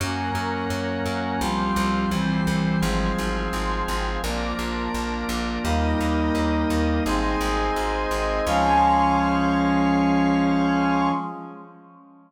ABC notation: X:1
M:4/4
L:1/8
Q:1/4=85
K:Db
V:1 name="Brass Section"
[G,B,D]4 [F,=G,C]2 [=E,G,C]2 | [F,A,C]4 [F,B,=D]4 | [=G,B,E]4 [A,CE]4 | [F,A,D]8 |]
V:2 name="Drawbar Organ"
[GBd]4 [F=Gc]2 [=EGc]2 | [FAc]4 [FB=d]4 | [=GBe]4 [Ace]4 | [Adf]8 |]
V:3 name="Electric Bass (finger)" clef=bass
G,, G,, G,, G,, C,, C,, C,, C,, | A,,, A,,, A,,, A,,, B,,, B,,, B,,, B,,, | E,, E,, E,, E,, A,,, A,,, A,,, A,,, | D,,8 |]